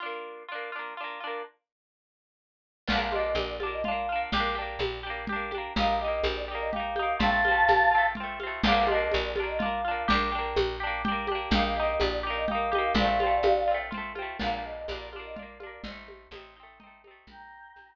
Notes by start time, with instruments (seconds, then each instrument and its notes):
0.00 acoustic guitar (steel) D4 F4
0.06 acoustic guitar (steel) A#3
0.48 acoustic guitar (steel) D4 F4
0.55 acoustic guitar (steel) A#3
0.72 acoustic guitar (steel) D4 F4
0.79 acoustic guitar (steel) A#3
0.97 acoustic guitar (steel) D4 F4
1.04 acoustic guitar (steel) A#3
1.20 acoustic guitar (steel) D4 F4
1.27 acoustic guitar (steel) A#3
2.88 electric bass (finger) A#1, acoustic guitar (steel) F4, choir aahs F5, crash, low conga
2.92 acoustic guitar (steel) A#3 D4
3.00 choir aahs F5
3.12 acoustic guitar (steel) D4 F4, choir aahs D#5, high conga
3.19 acoustic guitar (steel) A#3
3.24 choir aahs D#5
3.35 electric bass (finger) A#1, choir aahs D5, high conga
3.48 choir aahs D5
3.60 acoustic guitar (steel) D4 F4, high conga
3.66 acoustic guitar (steel) A#3
3.72 choir aahs D#5
3.84 acoustic guitar (steel) F4, choir aahs F5, low conga
3.88 acoustic guitar (steel) A#3 D4
4.09 acoustic guitar (steel) D4 F4
4.16 acoustic guitar (steel) A#3
4.32 electric bass (finger) A#1, acoustic guitar (steel) G4, low conga
4.37 acoustic guitar (steel) A#3 D4
4.55 acoustic guitar (steel) D4 G4
4.62 acoustic guitar (steel) A#3
4.79 electric bass (finger) A#1, high conga
5.03 acoustic guitar (steel) D4 G4
5.10 acoustic guitar (steel) A#3
5.27 acoustic guitar (steel) G4, low conga
5.32 acoustic guitar (steel) A#3 D4
5.51 acoustic guitar (steel) D4 G4, high conga
5.58 acoustic guitar (steel) A#3
5.76 electric bass (finger) A#1, acoustic guitar (steel) D#4 G4, choir aahs F5, low conga
5.83 acoustic guitar (steel) A#3
5.88 choir aahs F5
6.00 acoustic guitar (steel) G4, choir aahs D#5
6.04 acoustic guitar (steel) A#3 D#4
6.12 choir aahs D#5
6.24 electric bass (finger) A#1, choir aahs C5, high conga
6.36 choir aahs D5
6.48 acoustic guitar (steel) D#4 G4
6.55 acoustic guitar (steel) A#3
6.60 choir aahs D#5
6.72 acoustic guitar (steel) G4, choir aahs F5, low conga
6.76 acoustic guitar (steel) A#3 D#4
6.96 acoustic guitar (steel) D#4 G4, high conga
7.03 acoustic guitar (steel) A#3
7.19 electric bass (finger) A#1, acoustic guitar (steel) C4 F4, choir aahs F5 A5, low conga
7.26 acoustic guitar (steel) A3
7.45 acoustic guitar (steel) C4 F4, high conga
7.51 acoustic guitar (steel) A3
7.68 electric bass (finger) A#1, high conga
7.91 acoustic guitar (steel) C4 F4
7.98 acoustic guitar (steel) A3
8.15 acoustic guitar (steel) F4, low conga
8.20 acoustic guitar (steel) A3 C4
8.40 acoustic guitar (steel) C4 F4, high conga
8.47 acoustic guitar (steel) A3
8.63 electric bass (finger) A#1, acoustic guitar (steel) F4, choir aahs F5, crash, low conga
8.68 acoustic guitar (steel) A#3 D4
8.76 choir aahs F5
8.87 acoustic guitar (steel) F4, choir aahs D#5, high conga
8.91 acoustic guitar (steel) A#3 D4
9.00 choir aahs D#5
9.12 electric bass (finger) A#1, choir aahs D5, high conga
9.24 choir aahs D5
9.36 acoustic guitar (steel) D4 F4, high conga
9.43 acoustic guitar (steel) A#3
9.48 choir aahs D#5
9.59 acoustic guitar (steel) D4 F4, choir aahs F5, low conga
9.65 acoustic guitar (steel) A#3
9.84 acoustic guitar (steel) D4 F4
9.91 acoustic guitar (steel) A#3
10.08 electric bass (finger) A#1, acoustic guitar (steel) D4 G4, low conga
10.14 acoustic guitar (steel) A#3
10.32 acoustic guitar (steel) D4 G4
10.38 acoustic guitar (steel) A#3
10.56 electric bass (finger) A#1, high conga
10.80 acoustic guitar (steel) D4 G4
10.87 acoustic guitar (steel) A#3
11.05 acoustic guitar (steel) D4 G4, low conga
11.12 acoustic guitar (steel) A#3
11.27 acoustic guitar (steel) G4, high conga
11.31 acoustic guitar (steel) A#3 D4
11.51 electric bass (finger) A#1, acoustic guitar (steel) G4, choir aahs F5, low conga
11.55 acoustic guitar (steel) A#3 D#4
11.64 choir aahs F5
11.76 acoustic guitar (steel) D#4 G4, choir aahs D#5
11.83 acoustic guitar (steel) A#3
11.88 choir aahs D#5
12.00 electric bass (finger) A#1, choir aahs D5, high conga
12.12 choir aahs D5
12.23 acoustic guitar (steel) D#4 G4
12.30 acoustic guitar (steel) A#3
12.36 choir aahs D#5
12.48 acoustic guitar (steel) D#4 G4, choir aahs F5, low conga
12.55 acoustic guitar (steel) A#3
12.71 acoustic guitar (steel) D#4 G4, high conga
12.78 acoustic guitar (steel) A#3
12.94 electric bass (finger) A#1, acoustic guitar (steel) F4, choir aahs D5 F5, low conga
13.01 acoustic guitar (steel) A3 C4
13.20 acoustic guitar (steel) C4 F4, high conga
13.27 acoustic guitar (steel) A3
13.43 electric bass (finger) A#1, high conga
13.67 acoustic guitar (steel) C4 F4
13.74 acoustic guitar (steel) A3
13.91 acoustic guitar (steel) C4 F4, low conga
13.97 acoustic guitar (steel) A3
14.15 acoustic guitar (steel) C4 F4, high conga
14.22 acoustic guitar (steel) A3
14.39 electric bass (finger) A#1, acoustic guitar (steel) D4 F4, choir aahs F5, crash, low conga
14.46 acoustic guitar (steel) A#3
14.52 choir aahs F5
14.64 choir aahs D#5
14.76 choir aahs D#5
14.88 electric bass (finger) A#1, acoustic guitar (steel) D4 F4, choir aahs D5, high conga
14.95 acoustic guitar (steel) A#3
15.00 choir aahs D5
15.12 acoustic guitar (steel) D4 F4, high conga
15.19 acoustic guitar (steel) A#3
15.24 choir aahs D#5
15.36 acoustic guitar (steel) D4 F4, choir aahs D5, low conga
15.42 acoustic guitar (steel) A#3
15.60 acoustic guitar (steel) D4 F4, high conga
15.66 acoustic guitar (steel) A#3
15.84 electric bass (finger) A1, acoustic guitar (steel) C4 D#4, low conga
15.91 acoustic guitar (steel) A3
16.08 high conga
16.31 electric bass (finger) A1, acoustic guitar (steel) D#4, high conga
16.35 acoustic guitar (steel) A3 C4
16.56 acoustic guitar (steel) C4 D#4
16.63 acoustic guitar (steel) A3
16.80 acoustic guitar (steel) C4 D#4, low conga
16.87 acoustic guitar (steel) A3
17.04 acoustic guitar (steel) C4 D#4, high conga
17.11 acoustic guitar (steel) A3
17.27 electric bass (finger) A#1, choir aahs G5 A#5, low conga
17.76 electric bass (finger) A#1, high conga